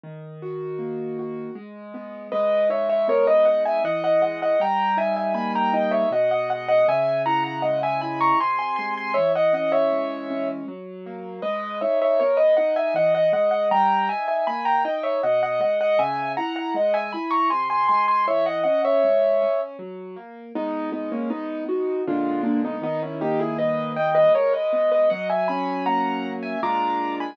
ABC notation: X:1
M:3/4
L:1/16
Q:1/4=79
K:G#m
V:1 name="Acoustic Grand Piano"
z12 | [Bd]2 [ce] [ce] [Ac] [Bd] [df] [eg] [df] [df] [df] [df] | [=ga]2 [e^g] [eg] [gb] [=ga] [dg] [ce] [df] [df] [df] [df] | [eg]2 [fa] [fa] [df] [eg] [gb] [ac'] [g^b] [gb] [gb] [gb] |
[ce] [df] [df] [ce]5 z4 | [Bd]2 [ce] [ce] [Ac] [Bd] [df] [eg] [df] [df] [df] [df] | [=ga]2 [e^g] [eg] [gb] [=ga] [dg] [ce] [df] [df] [df] [df] | [eg]2 [fa] [fa] [df] [eg] [gb] [ac'] [g^b] [gb] [gb] [gb] |
[ce] [df] [df] [ce]5 z4 | [B,D]2 [B,D] [A,C] [B,D]2 [DF]2 [=D^E]2 [A,D] [B,^D] | [B,D] [CE] [D=G] [E^G] [Bd]2 [d=g] [Bd] [Ac] [Bd]2 [Bd] | [df] [eg] [gb]2 [fa]3 [eg] [a=d']3 [gb] |]
V:2 name="Acoustic Grand Piano"
D,2 F2 A,2 F2 G,2 B,2 | G,2 D2 B,2 D2 E,2 G,2 | =G,2 D2 A,2 D2 B,,2 ^G,2 | C,2 E2 G,2 E2 ^B,,2 G,2 |
E,2 C2 G,2 C2 F,2 A,2 | G,2 D2 B,2 D2 E,2 G,2 | =G,2 D2 A,2 D2 B,,2 ^G,2 | C,2 E2 G,2 E2 ^B,,2 G,2 |
E,2 C2 G,2 C2 F,2 A,2 | G,2 z2 B,2 z2 [A,,=D,G,]4 | D,2 A,2 =G,2 A,2 ^G,2 B,2 | F,2 C2 A,2 C2 [A,,G,=D^E]4 |]